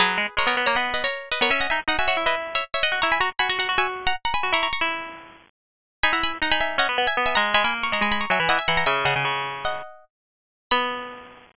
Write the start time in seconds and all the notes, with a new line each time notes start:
0.00 F#3 G#4 B4
0.18 G#3
0.37 G#3 A#4 C#5
0.47 B3 A#4 C#5
0.57 B3
0.66 A#3 A#4 C#5
0.75 B3 D#5 F#5
0.94 B4 D#5
1.04 A#4 C#5
1.32 B4 D#5
1.41 B3 A#4 C#5
1.50 C#4 E5 G#5
1.60 D#5 F#5
1.70 D#4 E5 G#5
1.88 D#4 D#5 F#5
1.99 F#4 E5 G#5
2.08 F#4 C#5 E5
2.17 E4
2.26 E4 B4 D#5
2.55 C#5 E5
2.74 C#5 E5
2.83 D#5 F#5
2.92 F#4
3.02 E4 A#5 C#6
3.12 G#5 B5
3.20 F#4 A#5 C#6
3.39 F#4 G#5 B5
3.49 F#4 A#5 C#6
3.59 F#4 F#5 A#5
3.69 F#4
3.78 F#4 E5 G#5
4.07 F#5 A#5
4.25 F#5 A#5
4.34 G#5 B5
4.43 F#4
4.52 E4 A#5 C#6
4.63 A#5 C#6
4.73 A#5 C#6
4.81 E4
6.03 D#4 G#5 B5
6.13 E4 F#5 A#5
6.24 G#5 B5
6.42 D#4 F#5 A#5
6.51 D#4 G#5 B5
6.61 E5 G#5
6.78 C#4 D#5 F#5
6.89 B3
6.98 B3
7.07 E5 G#5
7.17 B3
7.26 E5 G#5
7.35 G#3 F#5 A#5
7.54 G#3 G#5 B5
7.64 A#3 G#5 B5
7.83 A#5 C#6
7.92 G#3 A#5 C#6
8.01 G#3 G#5 B5
8.12 G#5 B5
8.21 A#5 C#6
8.30 F#3 E5 G#5
8.40 E3
8.49 E3 D#5 F#5
8.59 E5 G#5
8.68 E3 F#5 A#5
8.77 F#5 A#5
8.86 C#3 E5 G#5
9.05 C#3 D#5 F#5
9.16 C#3
9.25 C#3
9.65 D#5 F#5
10.71 B3 B5